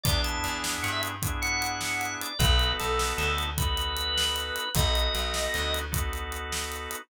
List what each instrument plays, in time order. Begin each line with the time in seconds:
0.04 electric bass (finger) E2, drawbar organ B3 D4 E4 G#4 D5, kick, closed hi-hat
0.24 drawbar organ A5, closed hi-hat
0.44 electric bass (finger) E2, closed hi-hat
0.64 snare
0.83 electric bass (finger) G2, drawbar organ F#5, closed hi-hat
0.92 drawbar organ E5
1.03 closed hi-hat
1.22 drawbar organ B3 D4 E4 G#4, kick, closed hi-hat
1.42 drawbar organ F#5, closed hi-hat
1.62 closed hi-hat
1.81 snare
2.01 closed hi-hat
2.21 drawbar organ D5, closed hi-hat
2.39 electric bass (finger) B1, drawbar organ B3 D#4 F#4 A4 B4, kick, closed hi-hat
2.59 closed hi-hat
2.80 electric bass (finger) B1, drawbar organ A4, closed hi-hat
2.99 snare
3.17 electric bass (finger) D2, drawbar organ A4, closed hi-hat
3.38 closed hi-hat
3.58 drawbar organ B3 D#4 F#4 A4 B4, kick, closed hi-hat
3.77 closed hi-hat
3.97 closed hi-hat
4.18 snare
4.36 closed hi-hat
4.56 closed hi-hat
4.75 electric bass (finger) B1, drawbar organ B3 D#4 F#4 A4 D#5, kick, closed hi-hat
4.95 closed hi-hat
5.15 electric bass (finger) B1, closed hi-hat
5.34 snare
5.54 electric bass (finger) D2, closed hi-hat
5.74 closed hi-hat
5.92 drawbar organ B3 D#4 F#4 A4, kick, closed hi-hat
6.13 closed hi-hat
6.32 closed hi-hat
6.52 snare
6.72 closed hi-hat
6.91 closed hi-hat